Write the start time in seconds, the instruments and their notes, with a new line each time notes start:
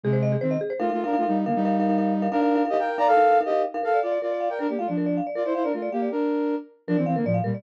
0.03 flute C3 G#3, marimba G#4
0.13 marimba C5
0.22 marimba D#5
0.32 marimba G#4
0.41 flute D#3 C4, marimba C5
0.51 marimba D#5
0.61 marimba G#4
0.70 marimba C5
0.80 flute A3 F4, marimba D#4 A#4 F5
0.89 flute A3 F4, marimba D#4 A#4 F5
1.04 flute D4 A#4, marimba D#4 A#4 F5
1.13 marimba D#4 A#4 F5
1.18 flute A3 F4
1.22 marimba D#4 A#4 F5
1.28 flute G3 D#4
1.46 flute D3 A#3, marimba D#4 A#4 F5
1.55 flute G3 D#4
1.65 marimba D#4 A#4 F5
1.80 marimba D#4 A#4 F5
1.89 marimba D#4 A#4 F5
1.98 marimba D#4 A#4 F5
2.22 marimba D#4 A#4 F5
2.32 flute D4 A#4, marimba D#4 A#4 F5
2.42 marimba D#4 A#4 F5
2.55 marimba D#4 A#4 F5
2.65 marimba D#4 A#4 F5
2.70 flute G4 D#5
2.74 marimba D#4 A#4 F5
2.79 flute A#4 G5
2.98 marimba D#4 A#4 F5, flute D5 A#5
3.07 flute A4 F5
3.17 marimba D#4 A#4 F5
3.31 marimba D#4 A#4 F5
3.41 marimba D#4 A#4 F5
3.45 flute G4 D#5
3.50 marimba D#4 A#4 F5
3.74 marimba D#4 A#4 F5
3.83 flute A4 F5, marimba A#4
3.94 marimba D5
4.03 flute F4 D5, marimba F5
4.12 marimba D5
4.22 flute F4 D5, marimba A#4
4.31 marimba D5
4.40 marimba F5
4.50 flute A#4 G5, marimba D5
4.59 flute D4 A#4, marimba A#4
4.69 flute A#3 G4, marimba D5
4.79 flute A3 F4, marimba F5
4.88 flute F3 D4, marimba D5
4.97 marimba A#4
5.06 marimba D5
5.17 marimba F5
5.27 marimba D5
5.35 flute F4 D5, marimba A#4
5.45 flute E4 C5, marimba D5
5.55 flute E4 C5, marimba F5
5.64 flute D4 A#4, marimba D5
5.73 flute A3 F4, marimba A#4
5.82 marimba D5
5.92 flute A#3 G4, marimba F5
6.02 marimba D5
6.11 flute D4 A#4
6.88 flute F3 D4, marimba A#4
6.97 flute E3 C4, marimba D5
7.06 flute E3 C4, marimba F5
7.16 flute D3 A#3, marimba A#4
7.25 flute A2 F3, marimba D5
7.34 marimba F5
7.44 flute A#2 G3, marimba A#4
7.54 marimba D5